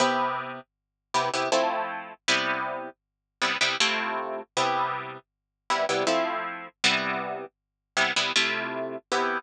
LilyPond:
\new Staff { \time 3/4 \key c \mixolydian \tempo 4 = 79 <c b e' g'>4. <c b e' g'>16 <c b e' g'>16 <f a c' e'>4 | <c g b e'>4. <c g b e'>16 <c g b e'>16 <c a e' f'>4 | <c g b e'>4. <c g b e'>16 <c g b e'>16 <f a c' e'>4 | <c g b e'>4. <c g b e'>16 <c g b e'>16 <c a e' f'>4 |
<c b e' g'>4 r2 | }